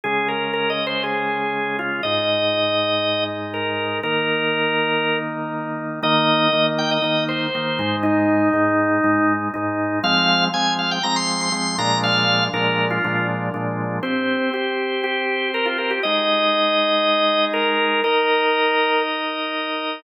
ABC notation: X:1
M:4/4
L:1/16
Q:1/4=120
K:Eb
V:1 name="Drawbar Organ"
A2 B2 (3B2 e2 c2 A6 F2 | e12 B4 | B10 z6 | e6 g e e2 c6 |
E12 E4 | f4 a2 f g b c'2 c' c'2 b2 | f4 B3 F3 z6 | C4 G4 G4 B F B G |
e12 B4 | B8 z8 |]
V:2 name="Drawbar Organ"
[_D,A,_D]16 | [A,,A,E]16 | [E,B,E]16 | [E,B,E]4 [E,B,E]4 [E,B,E]4 [E,B,E]2 [A,,A,E]2- |
[A,,A,E]4 [A,,A,E]4 [A,,A,E]4 [A,,A,]4 | [F,A,C]4 [F,A,C]4 [F,A,C]4 [F,A,C]2 [B,,F,A,D]2- | [B,,F,A,D]4 [B,,F,A,D]4 [B,,F,A,D]4 [B,,F,A,D]4 | [CGc]16 |
[A,EA]16 | [EBe]16 |]